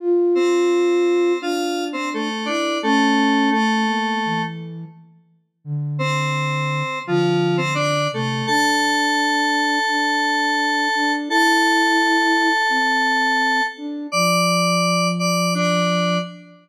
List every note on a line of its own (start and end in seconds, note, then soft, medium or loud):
0.00 1.33 F4 medium
0.35 1.38 C4 medium
0.35 1.38 C5 medium
1.40 2.29 D4 medium
1.40 1.84 F4 medium
1.40 1.84 F5 medium
1.93 2.09 C4 medium
1.93 2.09 C5 medium
2.14 2.47 A3 medium
2.14 2.47 A4 medium
2.45 2.78 D4 medium
2.45 2.79 E4 medium
2.45 2.78 D5 medium
2.82 3.50 A3 medium
2.82 3.51 C#4 medium
2.82 3.50 A4 medium
3.51 4.42 A3 medium
3.51 3.85 A3 medium
3.51 4.42 A4 medium
3.87 4.16 A#3 medium
4.25 4.85 E3 medium
5.65 6.83 D3 medium
5.99 6.99 C4 medium
5.99 6.99 C5 medium
7.06 8.07 D3 medium
7.06 7.57 F3 medium
7.06 7.57 F4 medium
7.57 7.74 C4 medium
7.57 7.74 C5 medium
7.75 8.08 D4 medium
7.75 8.08 D5 medium
8.12 8.42 C3 medium
8.12 8.46 A3 medium
8.12 8.46 A4 medium
8.47 9.79 D4 medium
8.47 11.12 A4 medium
8.47 11.12 A5 loud
9.88 10.88 D4 medium
10.95 11.29 D4 medium
11.28 12.49 E4 loud
11.28 13.63 A4 medium
11.28 13.63 A5 loud
12.70 13.61 C4 medium
13.77 14.07 D4 medium
14.12 16.19 F3 medium
14.12 15.08 D5 medium
14.12 15.08 D6 medium
15.19 15.53 D5 medium
15.19 15.53 D6 medium
15.54 16.18 D4 medium
15.54 16.18 D5 medium